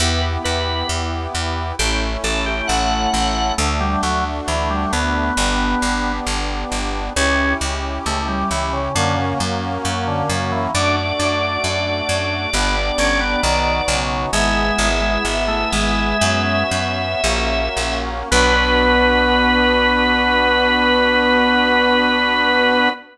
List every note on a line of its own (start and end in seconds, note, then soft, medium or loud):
0.00 0.38 E2 loud
0.00 1.76 B3 medium
0.00 1.76 E4 medium
0.00 1.76 G4 medium
0.00 0.21 B4 medium
0.44 0.83 E2 medium
0.44 0.87 B4 medium
0.89 1.27 E2 medium
1.35 1.73 E2 medium
1.79 2.17 A1 loud
1.79 3.55 A3 medium
1.79 3.55 C#4 medium
1.79 3.55 E4 medium
1.79 2.00 G4 medium
2.24 2.62 A1 medium
2.24 2.45 A4 medium
2.46 2.67 G4 medium
2.68 3.07 A1 medium
2.68 3.10 A3 medium
2.68 3.53 F#5 medium
3.13 3.52 A1 medium
3.13 3.54 A3 medium
3.58 3.96 D2 loud
3.58 3.79 A3 medium
3.58 5.34 A3 medium
3.58 5.34 D4 medium
3.58 5.34 F#4 medium
3.80 4.02 G3 medium
4.03 4.41 D2 medium
4.03 4.24 F#3 medium
4.48 4.86 D2 medium
4.48 4.69 E3 medium
4.70 4.92 G3 medium
4.93 5.31 D2 medium
4.93 6.12 B3 medium
5.37 5.75 G1 medium
5.37 7.13 B3 medium
5.37 7.13 D4 medium
5.37 7.13 G4 medium
5.82 6.20 G1 medium
6.26 6.65 G1 medium
6.72 7.10 G1 medium
7.16 7.54 C#2 loud
7.16 8.92 C#4 medium
7.16 7.53 C#4 medium
7.16 8.92 E4 medium
7.16 8.92 G4 medium
7.61 7.99 C#2 medium
8.06 8.44 C#2 medium
8.06 8.27 A3 medium
8.28 8.50 G3 medium
8.51 8.89 C#2 medium
8.51 8.72 E3 medium
8.73 8.94 C#3 medium
8.95 9.34 F#2 loud
8.95 9.16 D3 medium
8.95 10.71 A#3 medium
8.95 10.71 C#4 medium
8.95 10.71 F#4 medium
9.18 9.39 C#3 medium
9.40 9.78 F#2 medium
9.85 10.23 F#2 medium
10.07 10.29 D3 medium
10.29 10.68 F#2 medium
10.29 10.52 C#3 medium
10.52 10.73 E3 medium
10.75 11.13 F#2 medium
10.75 12.50 A3 medium
10.75 10.96 D4 medium
10.75 12.50 D4 medium
10.75 12.50 F#4 medium
10.75 13.97 D5 medium
11.19 11.58 F#2 medium
11.19 11.59 D4 medium
11.64 12.02 F#2 medium
12.09 12.47 F#2 medium
12.53 12.91 G1 medium
12.53 13.41 B3 medium
12.53 12.76 B3 medium
12.53 13.41 D4 medium
12.53 13.41 G4 medium
12.98 13.36 G1 medium
12.98 13.20 C#4 medium
13.20 13.42 B3 medium
13.43 13.81 B1 medium
13.43 13.82 D#3 medium
13.43 14.31 B3 medium
13.43 14.31 D#4 medium
13.43 14.31 F#4 medium
13.88 14.26 B1 medium
13.88 14.29 C#3 medium
14.32 14.71 G#1 medium
14.32 14.89 G#3 medium
14.32 16.17 B3 medium
14.32 16.17 E4 medium
14.32 16.17 G#4 medium
14.32 17.98 E5 medium
14.78 15.18 G#1 medium
15.01 15.23 G#3 medium
15.25 15.65 G#1 medium
15.48 15.71 A3 medium
15.72 16.14 G#1 medium
15.72 16.63 G#3 medium
16.21 16.64 F#2 loud
16.21 17.21 B3 medium
16.21 17.21 C#4 medium
16.21 17.21 F#4 medium
16.71 17.15 F#2 medium
17.24 17.69 A#1 medium
17.24 18.29 A#3 medium
17.24 18.29 C#4 medium
17.24 18.29 F#4 medium
17.77 18.23 A#1 medium
18.31 22.89 B1 loud
18.31 22.88 B3 loud
18.31 22.90 B3 loud
18.31 22.90 D4 loud
18.31 22.90 F#4 loud
18.31 22.89 B4 loud